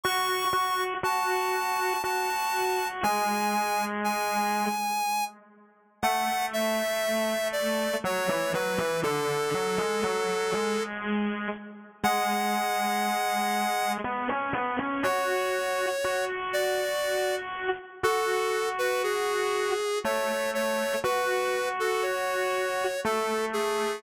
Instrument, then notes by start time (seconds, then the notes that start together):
lead 1 (square)
0.04 F#4 C#6
0.53 F#4
1.03 F#4 A5
2.04 F#4 A5
3.03 G#3 G#5
4.04 G#5
6.03 A3 F#5
6.53 E5
7.52 D5
8.04 F#3 C#5
8.29 E3
8.54 F#3 B4
8.78 E3
9.03 D3 A4
9.54 F#3
9.78 G#3
10.04 F#3
10.53 G#3
12.04 G#3 F#5
14.04 B3
14.29 C#4
14.53 B3
14.79 C#4
15.03 F#4 C#5
16.04 F#4
16.53 D5
18.03 F#4 A4
18.79 B4
19.03 G#4
20.04 A3 C#5
20.54 C#5
21.04 F#4 B4
21.80 A4
22.02 C#5
23.05 A3 A4
23.53 G#4